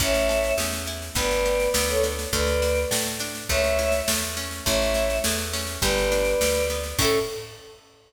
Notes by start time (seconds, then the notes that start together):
0.00 A1 C#4 C#5 E5, kick, snare
0.14 snare
0.29 A4, snare
0.44 snare
0.58 E2 C#4, snare
0.72 snare
0.86 E4, snare
1.02 snare
1.15 G1 B3 B4 D5, kick, snare
1.31 snare
1.46 G4, snare
1.60 snare
1.74 D2 B3 B4 D5, snare
1.89 A4 C#5, snare
2.03 D4, snare
2.19 snare
2.33 D2 A3 B4 D5, kick, snare
2.47 snare
2.62 F#4, snare
2.75 snare
2.91 A2 A3, snare
3.06 snare
3.20 D4, snare
3.35 snare
3.49 C#2 A3 C#5 E5, kick, snare
3.64 snare
3.79 E4, snare
3.92 snare
4.08 E2 A3, snare
4.23 snare
4.37 C#4, snare
4.51 snare
4.65 A1 A3 C#5 E5, kick, snare
4.82 snare
4.94 E4, snare
5.10 snare
5.24 E2 A3, snare
5.38 snare
5.53 C#4, snare
5.67 snare
5.81 G1 G3 B4 D5, kick, snare
5.98 snare
6.12 D4, snare
6.25 snare
6.41 D2 G3, snare
6.55 snare
6.70 B3, snare
6.84 snare
6.99 A2 C#4 E4 A4, kick, crash
7.05 A4